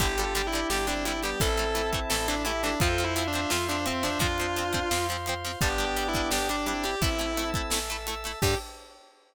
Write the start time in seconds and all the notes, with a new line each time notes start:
0.00 G1 D3 G3 D4 E4 G4 D5 G5, kick, closed hi-hat
0.18 D3 G3 F4 A4, closed hi-hat
0.24 G4
0.35 D3 G3, closed hi-hat
0.47 E4
0.53 D3 G3 E4 G4, closed hi-hat
0.70 G1 D3 G3 G4, snare
0.87 D3 G3 C4 D4 E4, closed hi-hat
1.05 D3 G3 E4, closed hi-hat
1.23 D3 G3 B3 G4, snare, closed hi-hat
1.40 A1 E3 A3 C4 E4 A4 E5 A5, kick, closed hi-hat
1.57 E3 A3, closed hi-hat
1.75 E3 A3, closed hi-hat
1.93 E3 A3, kick, closed hi-hat
2.10 A1 E3 A3 A4, snare
2.28 E3 A3 D4, closed hi-hat
2.45 E3 A3 E4 G4, closed hi-hat
2.63 E3 A3 D4, snare, closed hi-hat
2.80 F2 F3 C4 F4 A4 C5 F5 C6, kick, closed hi-hat
2.98 F3 C4, closed hi-hat
3.04 E4
3.16 F3 C4 C5 E5, closed hi-hat
3.27 D4
3.33 F3 C4, closed hi-hat
3.50 F2 F3 C4 F4, snare
3.69 F3 C4 D4, closed hi-hat
3.86 F3 C4 C5 E5, closed hi-hat
4.03 F3 C4 D4, snare, closed hi-hat
4.19 F2 F3 C4 D4 F4 C5 F5 C6, kick, closed hi-hat
4.38 F3 C4, closed hi-hat
4.56 F3 C4, closed hi-hat
4.73 F3 C4, kick, closed hi-hat
4.91 F2 F3 C4, snare
5.09 F3 C4, closed hi-hat
5.26 F3 C4, closed hi-hat
5.44 F3 C4, snare, closed hi-hat
5.61 G1 G3 B3 D4 G4 D5 G5 D6, kick, closed hi-hat
5.78 G3 D4, closed hi-hat
5.84 G4
5.96 G3 D4, closed hi-hat
6.08 E4
6.14 G3 D4, kick, closed hi-hat
6.31 G1 G3 D4 G4, snare
6.49 G3 D4, closed hi-hat
6.66 G3 C4 D4 E4, closed hi-hat
6.83 G3 D4 G4, snare, closed hi-hat
7.01 A1 A3 C4 E4 A4 E5 A5 E6, kick, closed hi-hat
7.19 A3 E4, closed hi-hat
7.37 A3 C4 E4, closed hi-hat
7.54 A3 E4, kick, closed hi-hat
7.70 A1 A3 E4, snare
7.90 A3 E4, closed hi-hat
8.07 A3 E4, closed hi-hat
8.24 A3 E4, snare, closed hi-hat
8.42 G2 D3 G3 D4 G4, kick, crash